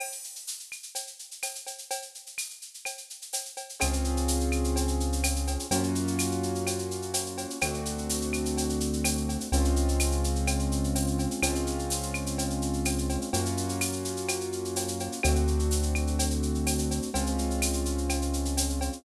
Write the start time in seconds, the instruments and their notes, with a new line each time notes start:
0.00 crash, cowbell, claves
0.12 shaker
0.24 shaker
0.35 shaker
0.47 tambourine, shaker
0.59 shaker
0.72 claves, shaker
0.83 shaker
0.95 cowbell, shaker
1.07 shaker
1.19 shaker
1.31 shaker
1.43 tambourine, cowbell, claves, shaker
1.55 shaker
1.67 cowbell, shaker
1.78 shaker
1.90 cowbell, shaker
2.02 shaker
2.15 shaker
2.26 shaker
2.38 tambourine, claves, shaker
2.50 shaker
2.62 shaker
2.74 shaker
2.85 cowbell, claves, shaker
2.98 shaker
3.10 shaker
3.22 shaker
3.33 tambourine, cowbell, shaker
3.45 shaker
3.57 cowbell, shaker
3.69 shaker
3.80 synth bass 1 C#2, acoustic grand piano C4 C#4 F4 G#4, cowbell, claves, shaker
3.93 shaker
4.04 shaker
4.17 shaker
4.28 tambourine, shaker
4.40 shaker
4.52 claves, shaker
4.64 shaker
4.76 cowbell, shaker
4.88 shaker
5.00 shaker
5.12 shaker
5.24 tambourine, cowbell, claves, shaker
5.36 shaker
5.47 cowbell, shaker
5.59 shaker
5.71 synth bass 1 F#2, acoustic grand piano A#3 C#4 F4 F#4, cowbell, shaker
5.83 shaker
5.95 shaker
6.07 shaker
6.19 tambourine, claves, shaker
6.31 shaker
6.43 shaker
6.55 shaker
6.67 cowbell, claves, shaker
6.79 shaker
6.91 shaker
7.02 shaker
7.14 tambourine, cowbell, shaker
7.26 shaker
7.38 cowbell, shaker
7.50 shaker
7.61 synth bass 1 D2, acoustic grand piano A3 C4 D4 F#4, cowbell, claves, shaker
7.74 shaker
7.85 shaker
7.98 shaker
8.10 tambourine, shaker
8.21 shaker
8.33 claves, shaker
8.45 shaker
8.57 cowbell, shaker
8.69 shaker
8.80 shaker
8.93 shaker
9.04 tambourine, cowbell, claves, shaker
9.17 shaker
9.29 cowbell, shaker
9.40 shaker
9.52 synth bass 1 C#2, acoustic grand piano G#3 C4 C#4 F4, cowbell, shaker
9.65 shaker
9.76 shaker
9.88 shaker
10.00 tambourine, claves, shaker
10.12 shaker
10.24 shaker
10.36 shaker
10.47 cowbell, claves, shaker
10.59 shaker
10.72 shaker
10.84 shaker
10.95 tambourine, cowbell, shaker
11.07 shaker
11.19 cowbell, shaker
11.31 shaker
11.42 synth bass 1 C#2, acoustic grand piano G#3 C4 C#4 F4, cowbell, claves, shaker
11.55 shaker
11.67 shaker
11.79 shaker
11.90 tambourine, shaker
12.02 shaker
12.14 claves, shaker
12.26 shaker
12.38 cowbell, shaker
12.50 shaker
12.62 shaker
12.73 shaker
12.85 tambourine, cowbell, claves, shaker
12.98 shaker
13.09 cowbell, shaker
13.21 shaker
13.33 synth bass 1 F#2, acoustic grand piano A#3 C#4 F4 F#4, cowbell, shaker
13.45 shaker
13.57 shaker
13.69 shaker
13.81 tambourine, claves, shaker
13.93 shaker
14.05 shaker
14.17 shaker
14.28 cowbell, claves, shaker
14.41 shaker
14.52 shaker
14.65 shaker
14.76 tambourine, cowbell, shaker
14.88 shaker
15.00 cowbell, shaker
15.12 shaker
15.23 synth bass 1 D2, acoustic grand piano A3 C4 D4 F#4, cowbell, claves, shaker
15.36 shaker
15.47 shaker
15.59 shaker
15.71 tambourine, shaker
15.83 shaker
15.95 claves, shaker
16.07 shaker
16.19 cowbell, shaker
16.30 shaker
16.43 shaker
16.55 shaker
16.67 tambourine, cowbell, claves, shaker
16.79 shaker
16.91 cowbell, shaker
17.02 shaker
17.14 synth bass 1 C#2, acoustic grand piano G#3 C4 C#4 F4, cowbell, shaker
17.26 shaker
17.38 shaker
17.50 shaker
17.62 tambourine, claves, shaker
17.73 shaker
17.85 shaker
17.98 shaker
18.09 cowbell, claves, shaker
18.22 shaker
18.33 shaker
18.45 shaker
18.57 tambourine, cowbell, shaker
18.69 shaker
18.81 cowbell, shaker
18.93 shaker